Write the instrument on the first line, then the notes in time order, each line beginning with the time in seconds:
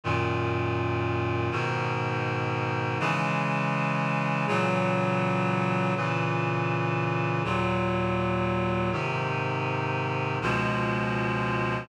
clarinet
0.04 F#2 A#2 D#3
1.51 G#2 B2 D#3
3.00 C#3 E3 G#3
4.47 A#2 C#3 E3 F#3
5.96 A#2 C#3 E3
7.44 D#2 A#2 F#3
8.92 G#2 C3 D#3
10.41 C#2 B2 F3 G#3